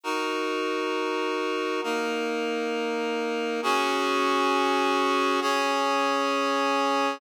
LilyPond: \new Staff { \time 6/8 \key des \major \tempo 4. = 67 <ees' ges' bes'>2. | <bes ees' bes'>2. | <des' ges' aes'>2. | <des' aes' des''>2. | }